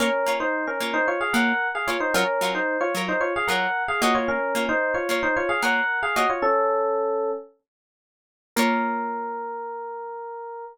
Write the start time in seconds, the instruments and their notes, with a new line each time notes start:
0.00 pizzicato strings A#3 F4 C#5, electric piano 1 C#4 A#4
0.26 pizzicato strings A#3 F4 C#5
0.40 electric piano 1 D#4 C5
0.67 electric piano 1 C#4 A#4
0.80 pizzicato strings A#3 F4 C#5
0.94 electric piano 1 D#4 C5
1.08 electric piano 1 F4 C#5
1.21 electric piano 1 G#4 F5
1.33 pizzicato strings A#3 F4 C#5, electric piano 1 A#4 F#5
1.75 electric piano 1 G#4 F5
1.87 pizzicato strings A#3 F4 C#5, electric piano 1 F4 C#5
2.00 electric piano 1 D#4 C5
2.14 pizzicato strings F#3 F4 A#4 C#5, electric piano 1 C#4 A#4
2.41 pizzicato strings F#3 F4 A#4 C#5
2.55 electric piano 1 D#4 C5
2.81 electric piano 1 F4 C#5
2.95 pizzicato strings F#3 F4 A#4 C#5
3.08 electric piano 1 D#4 C5
3.21 electric piano 1 F4 C#5
3.36 electric piano 1 G#4 F5
3.48 pizzicato strings F#3 F4 A#4, electric piano 1 A#4 F#5
3.52 pizzicato strings C#5
3.88 electric piano 1 G#4 F5
4.02 pizzicato strings A#3 F4 C#5, electric piano 1 F#4 D#5
4.15 electric piano 1 F4 C#5
4.28 electric piano 1 C#4 A#4
4.55 pizzicato strings A#3 F4 C#5
4.69 electric piano 1 D#4 C5
4.94 electric piano 1 F4 C#5
5.09 pizzicato strings A#3 F4 C#5
5.23 electric piano 1 D#4 C5
5.36 electric piano 1 F4 C#5
5.49 electric piano 1 G#4 F5
5.62 pizzicato strings A#3 F4 C#5, electric piano 1 A#4 F#5
6.03 electric piano 1 G#4 F5
6.16 pizzicato strings A#3 F4 C#5, electric piano 1 F#4 D#5
6.30 electric piano 1 F4 C#5
6.42 electric piano 1 C#4 A4
8.56 pizzicato strings A#3 F4 C#5, electric piano 1 A#4